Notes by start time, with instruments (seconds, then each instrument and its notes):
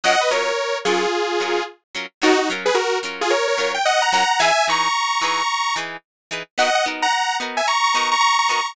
0.04 acoustic guitar (steel) F#3 C#4 F4 A#4, lead 2 (sawtooth) D#5 F#5
0.21 lead 2 (sawtooth) B4 D#5
0.31 acoustic guitar (steel) F#3 C#4 F4 A#4, lead 2 (sawtooth) A#4 C#5
0.85 acoustic guitar (steel) F#3 C#4 F4 A#4, lead 2 (sawtooth) F4 G#4
1.40 acoustic guitar (steel) F#3 C#4 F4 A#4
1.95 acoustic guitar (steel) F#3 C#4 F4 A#4
2.22 acoustic guitar (steel) F#3 C#4 F4 A#4, lead 2 (sawtooth) D#4 F#4
2.39 lead 2 (sawtooth) D#4 F#4
2.50 acoustic guitar (steel) F#3 C#4 F4 A#4
2.66 lead 2 (sawtooth) G#4 B4
2.75 lead 2 (sawtooth) F#4 A#4
3.03 acoustic guitar (steel) F#3 C#4 F4 A#4
3.21 lead 2 (sawtooth) F4 G#4
3.30 lead 2 (sawtooth) A#4 C#5
3.48 lead 2 (sawtooth) A#4 C#5
3.58 acoustic guitar (steel) F#3 C#4 F4 A#4
3.74 lead 2 (sawtooth) G5
3.85 lead 2 (sawtooth) D#5 F#5
4.02 lead 2 (sawtooth) F#5 A#5
4.12 acoustic guitar (steel) F#3 C#4 F4 A#4, lead 2 (sawtooth) F#5 A#5
4.31 lead 2 (sawtooth) F#5 A#5
4.40 acoustic guitar (steel) E3 D#4 G#4 B4, lead 2 (sawtooth) E5 G#5
4.68 acoustic guitar (steel) E3 D#4 G#4 B4, lead 2 (sawtooth) A#5 C#6
5.21 acoustic guitar (steel) E3 D#4 G#4 B4
5.76 acoustic guitar (steel) E3 D#4 G#4 B4
6.31 acoustic guitar (steel) E3 D#4 G#4 B4
6.58 acoustic guitar (steel) B3 D#4 F#4 A#4, lead 2 (sawtooth) D#5 F#5
6.75 lead 2 (sawtooth) D#5 F#5
6.86 acoustic guitar (steel) B3 D#4 F#4 A#4
7.02 lead 2 (sawtooth) F#5 A#5
7.12 lead 2 (sawtooth) F#5 A#5
7.40 acoustic guitar (steel) B3 D#4 F#4 A#4
7.57 lead 2 (sawtooth) E5 G#5
7.68 lead 2 (sawtooth) A#5 C#6
7.84 lead 2 (sawtooth) A#5 C#6
7.94 acoustic guitar (steel) B3 D#4 F#4 A#4
8.11 lead 2 (sawtooth) A#5 C#6
8.21 lead 2 (sawtooth) A#5 C#6
8.39 lead 2 (sawtooth) A#5 C#6
8.49 acoustic guitar (steel) B3 D#4 F#4 A#4, lead 2 (sawtooth) A#5 C#6
8.66 lead 2 (sawtooth) A#5 C#6